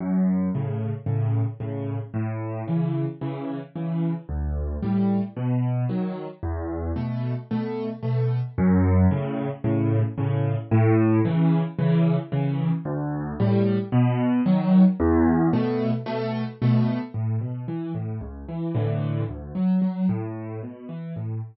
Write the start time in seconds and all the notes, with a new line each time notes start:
0.00 F#2
0.55 A2 C#3
1.06 A2 C#3
1.60 A2 C#3
2.14 A2
2.68 C#3 E3
3.21 C#3 E3
3.75 C#3 E3
4.29 D2
4.82 A2 G3
5.36 B2
5.89 D#3 F#3
6.43 E2
6.96 B2 A3
7.51 B2 A3
8.03 B2 A3
8.58 F#2
9.11 A2 C#3
9.64 A2 C#3
10.18 A2 C#3
10.71 A2
11.25 C#3 E3
11.79 C#3 E3
12.32 C#3 E3
12.85 D2
13.40 A2 G3
13.92 B2
14.46 D#3 F#3
15.00 E2
15.53 B2 A3
16.06 B2 A3
16.62 B2 A3
17.14 A2
17.41 B2
17.68 E3
17.95 A2
18.21 C#2
18.49 E3
18.75 A2 D3 E3
19.29 D2
19.55 F#3
19.82 F#3
20.09 A2
20.63 B2
20.89 E3
21.16 A2